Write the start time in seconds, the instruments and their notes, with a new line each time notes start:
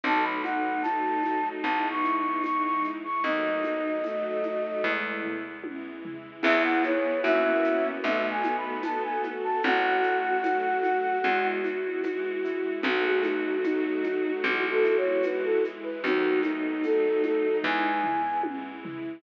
0.04 electric bass (finger) B1, acoustic grand piano F#3, string ensemble 1 F#3 A3 B3 D#4, violin D#4, flute A5, low conga, shaker
0.23 flute B5
0.44 acoustic grand piano A3, flute F#5, high conga, shaker
0.82 string ensemble 1 F#3 A3 D#4 F#4, acoustic grand piano B3, flute A5, tambourine, high conga, shaker
1.23 acoustic grand piano D#4, high conga, shaker
1.63 electric bass (finger) B1, string ensemble 1 G#3 B3 E4, acoustic grand piano G#3, flute A5, low conga, shaker
1.90 flute C#6
2.04 acoustic grand piano E4, shaker
2.18 flute C#6
2.44 string ensemble 1 E3 G#3 E4, acoustic grand piano B3, flute C#6, tambourine, high conga, shaker
2.64 flute C#6
2.84 acoustic grand piano E4, shaker
3.04 flute C#6
3.24 electric bass (finger) D#2, string ensemble 1 F#3 A3 B3 D#4, acoustic grand piano F#3, violin D#4, flute D#5, low conga, shaker
3.63 acoustic grand piano A3, high conga, shaker
4.04 string ensemble 1 F#3 A3 D#4 F#4, violin A3, acoustic grand piano B3, tambourine, high conga, shaker
4.43 acoustic grand piano D#4, high conga, shaker
4.83 electric bass (finger) E2, acoustic grand piano G#3, string ensemble 1 G#3 B3 E4, kick
5.23 acoustic grand piano E4, floor tom
5.63 string ensemble 1 E3 G#3 E4, acoustic grand piano B3, high tom
6.05 acoustic grand piano E4, floor tom
6.43 electric bass (finger) E2, acoustic grand piano B3 E4 G#4, violin B3, string ensemble 1 B3 E4 G#4, flute E5, crash, low conga, shaker
6.64 flute F#5
6.84 flute C#5, high conga, shaker
7.23 electric bass (finger) F#2, acoustic grand piano A#3 C#4 E4 F#4, string ensemble 1 A#3 C#4 E4 F#4, flute E5, tambourine, high conga, shaker
7.64 shaker
8.03 electric bass (finger) B1, string ensemble 1 A3 B3 D#4 F#4, acoustic grand piano A3, flute E5, low conga, shaker
8.30 flute G#5
8.44 acoustic grand piano B3, high conga, shaker
8.58 flute B5
8.83 string ensemble 1 A3 B3 F#4 A4, acoustic grand piano D#4, flute A5, tambourine, high conga, shaker
9.03 flute G#5
9.24 acoustic grand piano F#4, high conga, shaker
9.44 flute A5
9.63 electric bass (finger) A1, string ensemble 1 A3 C#4 F#4, acoustic grand piano A3, violin F#4, flute F#5, low conga, shaker
10.03 acoustic grand piano F#4, shaker
10.43 string ensemble 1 F#3 A3 F#4, acoustic grand piano C#4, tambourine, high conga, shaker
10.83 acoustic grand piano F#4, high conga, shaker
11.24 electric bass (finger) E2, string ensemble 1 G#3 B3 E4, acoustic grand piano G#3, low conga, shaker
11.64 acoustic grand piano E4, high conga, shaker
12.04 string ensemble 1 E3 G#3 E4, acoustic grand piano B3, tambourine, high conga, shaker
12.44 acoustic grand piano E4, shaker
12.83 electric bass (finger) B1, acoustic grand piano F#3, string ensemble 1 F#3 A3 B3 D#4, violin F#4, flute F#4, low conga, shaker
13.05 flute G#4
13.23 acoustic grand piano A3, flute D#4, high conga, shaker
13.64 string ensemble 1 F#3 A3 D#4 F#4, acoustic grand piano B3, flute D#4, tambourine, high conga, shaker
14.04 acoustic grand piano D#4, high conga, shaker
14.43 electric bass (finger) B1, acoustic grand piano G#3, string ensemble 1 G#3 B3 E4, flute F#4, low conga, shaker
14.71 flute A4
14.83 acoustic grand piano E4, shaker
14.97 flute C#5
15.23 string ensemble 1 E3 G#3 E4, acoustic grand piano B3, flute B4, tambourine, high conga, shaker
15.44 flute A4
15.64 acoustic grand piano E4, shaker
15.83 flute B4
16.04 electric bass (finger) D#2, acoustic grand piano F#3, string ensemble 1 F#3 A3 B3 D#4, violin D#4, flute F#4, low conga, shaker
16.43 acoustic grand piano A3, flute D#4, high conga, shaker
16.84 string ensemble 1 F#3 A3 D#4 F#4, acoustic grand piano B3, flute A4, tambourine, high conga, shaker
17.23 acoustic grand piano D#4, flute A4, high conga, shaker
17.64 electric bass (finger) E2, string ensemble 1 G#3 B3 E4, acoustic grand piano G#3, flute G#5, kick
18.04 acoustic grand piano E4, floor tom
18.43 string ensemble 1 E3 G#3 E4, acoustic grand piano B3, high tom
18.84 acoustic grand piano E4, floor tom